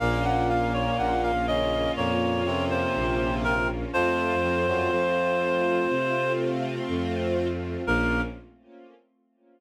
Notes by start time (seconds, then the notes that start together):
0.00 A#1 A#2 A#3 C#4 F4 F5
0.25 F#5
0.49 F5
0.74 C#5
0.98 A#1 F#5
1.23 F5
1.48 C#3 C#4 D#5
1.97 F2 A#2 A#3 C#5
2.46 C3 C4
2.70 C5
2.95 A#1
3.44 A#4
3.93 F2 F3 A3 C4 F4 C5
4.43 F2 F3
4.67 F#2 F#3
4.91 F2 F3
5.90 C3
6.88 F2
7.85 A#1 A#3 C#4 F4 A#4